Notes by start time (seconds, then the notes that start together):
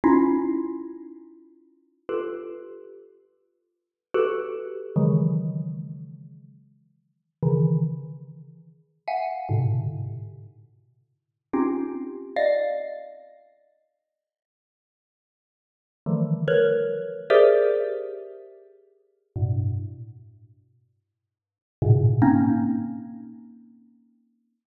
0.04 C#4 D#4 E4 F4
2.09 F4 G4 A4 B4
4.14 F#4 G4 A4 B4
4.96 C#3 D#3 E3 F#3 G#3
7.43 C#3 D#3 E3
9.08 E5 F5 F#5 G#5
9.49 G#2 A2 B2 C3 D3
11.53 C4 C#4 D#4 F4 G4
12.36 D5 D#5 F5
16.06 D3 D#3 E3 F3 G3 A3
16.48 A#4 B4 C#5
17.30 G4 G#4 A#4 C5 D5 E5
19.36 G2 A2 B2
21.82 G#2 A2 A#2 B2 C#3
22.22 A#3 C4 C#4 D#4